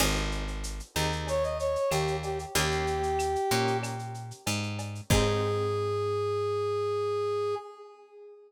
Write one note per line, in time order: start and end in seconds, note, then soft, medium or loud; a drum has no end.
0.00 0.81 G#1 loud
0.00 0.44 C4 loud
0.00 0.44 D#4 loud
0.00 0.44 G4 loud
0.00 0.44 G#4 loud
0.00 crash loud
0.00 cowbell loud
0.00 claves loud
0.16 shaker medium
0.32 shaker medium
0.48 shaker medium
0.64 shaker loud
0.80 shaker medium
0.96 1.77 D#2 medium
0.96 1.41 C4 medium
0.96 1.41 D#4 medium
0.96 1.41 G4 loud
0.96 1.41 G#4 medium
0.96 claves medium
0.96 shaker medium
1.12 shaker medium
1.27 1.43 C#5 medium
1.27 cowbell medium
1.27 shaker loud
1.43 1.58 D#5 medium
1.43 shaker medium
1.59 1.90 C#5 medium
1.59 shaker medium
1.76 shaker medium
1.91 2.46 D#2 medium
1.91 2.17 G4 medium
1.91 cowbell medium
1.91 claves loud
1.91 shaker loud
2.08 shaker medium
2.23 2.39 G4 medium
2.23 cowbell medium
2.23 shaker medium
2.39 shaker medium
2.55 3.37 D#2 loud
2.55 3.00 A#3 loud
2.55 3.00 C#4 loud
2.55 3.00 D#4 loud
2.55 3.77 G4 medium
2.55 3.00 G4 loud
2.55 cowbell loud
2.55 shaker loud
2.71 shaker medium
2.87 shaker medium
3.03 shaker medium
3.19 claves loud
3.19 shaker loud
3.36 shaker medium
3.51 4.32 A#2 medium
3.51 3.96 A#3 medium
3.51 3.96 C#4 medium
3.51 3.96 D#4 medium
3.51 3.96 G4 medium
3.51 shaker medium
3.67 shaker medium
3.83 cowbell medium
3.83 claves loud
3.83 shaker loud
3.99 shaker medium
4.14 shaker medium
4.31 shaker medium
4.47 5.01 G#2 medium
4.47 cowbell medium
4.47 shaker loud
4.63 shaker medium
4.79 cowbell medium
4.79 shaker medium
4.95 shaker medium
5.10 7.55 G#2 loud
5.10 7.54 C4 loud
5.10 7.54 D#4 medium
5.10 7.54 G4 medium
5.10 7.54 G#4 loud
5.10 7.55 G#4 loud
5.10 kick loud
5.10 crash loud